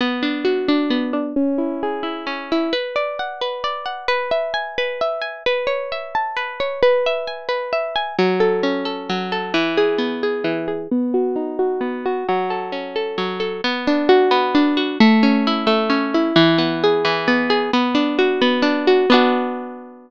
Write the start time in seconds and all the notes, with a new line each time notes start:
0.01 B3
0.23 D4
0.45 F#4
0.68 D4
0.90 B3
1.13 D4
1.36 C#4
1.58 E4
1.83 G#4
2.03 E4
2.27 C#4
2.52 E4
2.73 B4
2.96 D5
3.19 F#5
3.41 B4
3.64 D5
3.86 F#5
4.08 B4
4.31 E5
4.54 G#5
4.78 B4
5.01 E5
5.21 G#5
5.46 B4
5.67 C#5
5.92 E5
6.15 A5
6.37 B4
6.60 C#5
6.83 B4
7.06 E5
7.27 G#5
7.49 B4
7.73 E5
7.96 G#5
8.19 F#3
8.40 A4
8.63 C#4
8.85 A4
9.09 F#3
9.32 A4
9.54 E3
9.77 G#4
9.98 B3
10.23 G#4
10.44 E3
10.68 G#4
10.91 B3
11.14 F#4
11.36 D#4
11.59 F#4
11.81 B3
12.06 F#4
12.29 F#3
12.50 A4
12.72 C#4
12.96 A4
13.18 F#3
13.40 A4
13.64 B3
13.87 D4
14.09 F#4
14.31 B3
14.55 D4
14.77 F#4
15.00 A3
15.23 C#4
15.47 E4
15.67 A3
15.90 C#4
16.14 E4
16.36 E3
16.58 B3
16.84 G#4
17.05 E3
17.28 B3
17.50 G#4
17.73 B3
17.95 D4
18.19 F#4
18.41 B3
18.62 D4
18.87 F#4
19.10 B3 D4 F#4